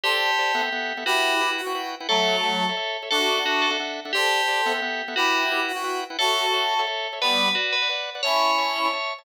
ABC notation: X:1
M:6/8
L:1/16
Q:3/8=117
K:Amix
V:1 name="Tubular Bells"
G12 | F6 z6 | A12 | A4 F2 A2 z4 |
G12 | F6 z6 | A12 | B4 F2 B2 z4 |
c12 |]
V:2 name="Clarinet"
[A=c]8 z4 | [EG]6 F4 z2 | [F,A,]8 z4 | [DF]8 z4 |
[A=c]8 z4 | [EG]6 F4 z2 | [FA]8 z4 | [G,B,]4 z8 |
[CE]8 z4 |]
V:3 name="Drawbar Organ"
[G=cd]4 [Gcd]2 [B,Aef] [B,Aef] [B,Aef]3 [B,Aef] | [EBfg]4 [EBfg]3 [EBfg] [EBfg]3 [EBfg] | [Ace]4 [Ace]3 [Ace] [Ace]3 [Ace] | [DAef]4 [DAef]3 [DAef] [DAef]3 [DAef] |
[G=cd]4 [Gcd]2 [B,Aef] [B,Aef] [B,Aef]3 [B,Aef] | [EBfg]4 [EBfg]3 [EBfg] [EBfg]3 [EBfg] | [Ace]4 [Ace]3 [Ace] [Ace]3 [Ace] | [Bdf]4 [Bdf]3 [Bdf] [Bdf]3 [Bdf] |
[cea]4 [cea]3 [cea] [cea]3 [cea] |]